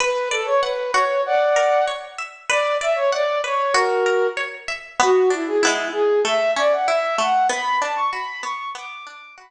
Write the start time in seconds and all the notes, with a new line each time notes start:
0.00 B4
0.31 A4 D5
0.46 C#5
0.61 B4 F#5
0.93 F#4 C#5
1.26 D5 F#5
1.56 A#4
1.88 C#5
2.18 E5
2.49 B4 D5
2.81 D5 E5
2.96 C#5
3.12 D5 F#5
3.44 B4 C#5
3.73 F#4 A#4
4.06 A#4
4.37 C#5
4.68 E5
5.00 B3 F#4
5.30 D4 E4
5.47 G#4
5.61 B3 E4
5.67 G#3
5.92 G#4
6.25 A3 E5
6.56 C#4 D5
6.73 F#5
6.88 E4 E5
7.18 A3 F#5
7.49 B3 B5
7.82 D4 A5
7.96 C#6
8.11 F#4 B5
8.43 B3 C#6
8.75 B3 D6
9.06 D4 D6
9.38 F#4 B5